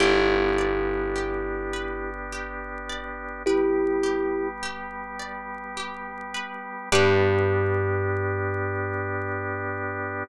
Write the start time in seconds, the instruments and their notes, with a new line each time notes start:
0.00 electric bass (finger) G1, drawbar organ B3 D4 G4, kalimba E4 G4, pizzicato strings G4
0.58 pizzicato strings D5
1.15 pizzicato strings G4
1.73 pizzicato strings B4
2.32 pizzicato strings G4
2.89 pizzicato strings D5
3.46 drawbar organ G3 B3 G4, kalimba E4 G4, pizzicato strings B4
4.03 pizzicato strings G4
4.63 pizzicato strings G4
5.19 pizzicato strings D5
5.77 pizzicato strings G4
6.34 pizzicato strings B4
6.92 electric bass (finger) G2, drawbar organ B3 D4 G4, pizzicato strings G4 B4 D5, kalimba G4